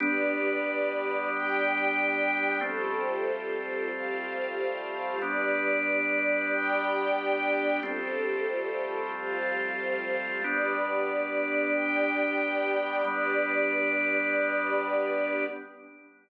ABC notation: X:1
M:4/4
L:1/8
Q:1/4=92
K:Gmix
V:1 name="Drawbar Organ"
[G,B,D]8 | [F,G,A,C]8 | [G,B,D]8 | [F,G,A,C]8 |
[G,B,D]8 | [G,B,D]8 |]
V:2 name="String Ensemble 1"
[GBd]4 [Gdg]4 | [FGAc]4 [FGcf]4 | [GBd]4 [Gdg]4 | [FGAc]4 [FGcf]4 |
[GBd]4 [Gdg]4 | [GBd]8 |]